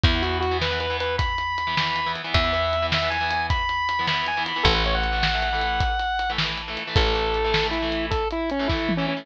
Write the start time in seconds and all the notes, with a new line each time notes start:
0.04 E2 E3 B3 E4, kick, closed hi-hat
0.14 E3 B3
0.22 E3 B3 F#4, closed hi-hat
0.40 F#4, closed hi-hat
0.51 E3 B3
0.62 B4, snare
0.71 E3 B3
0.80 B4, closed hi-hat
0.90 E3 B3
1.00 B4, closed hi-hat
1.18 B5, kick, closed hi-hat
1.38 closed hi-hat
1.58 closed hi-hat
1.67 E3 B3
1.77 E3 B3, snare
1.96 closed hi-hat
2.06 E3 B3
2.16 closed hi-hat
2.24 E3 B3
2.34 E2 E5, kick, closed hi-hat
2.44 E3 B3
2.53 E3 B3, closed hi-hat
2.73 closed hi-hat
2.82 E3 B3
2.92 E5, snare
3.02 E3 B3
3.10 G#5, closed hi-hat
3.21 E3 B3
3.31 closed hi-hat
3.50 B5, kick, closed hi-hat
3.69 closed hi-hat
3.89 closed hi-hat
3.99 E3 B3
4.07 E3 B3 B5, snare
4.27 G#5, closed hi-hat
4.37 E3 B3
4.46 B5, closed hi-hat
4.56 E3 B3
4.63 A1 E3 A3 A4, kick, closed hi-hat
4.74 E3 A3 B4
4.84 E3 A3 C#5, closed hi-hat
4.95 F#5
5.04 closed hi-hat
5.12 E3 A3
5.23 snare
5.34 E3 A3
5.42 closed hi-hat
5.53 E3 A3
5.61 closed hi-hat
5.80 kick, closed hi-hat
6.00 closed hi-hat
6.19 closed hi-hat
6.30 E3 A3
6.38 E3 A3, snare
6.58 closed hi-hat
6.68 E3 A3
6.77 closed hi-hat
6.87 E3 A3
6.96 A1 A4, kick, closed hi-hat
7.06 E3 A3
7.15 E3 A3, closed hi-hat
7.34 closed hi-hat
7.44 E3 A3
7.54 snare
7.62 E3 A3
7.71 E4, closed hi-hat
7.82 E3 A3
7.92 closed hi-hat
8.11 A4, kick, closed hi-hat
8.31 E4, closed hi-hat
8.50 C#4, closed hi-hat
8.59 E3 A3
8.68 E3 A3 E4, kick, snare
8.89 high tom
8.97 E3 A3 C#4
9.08 C#4
9.17 E3 A3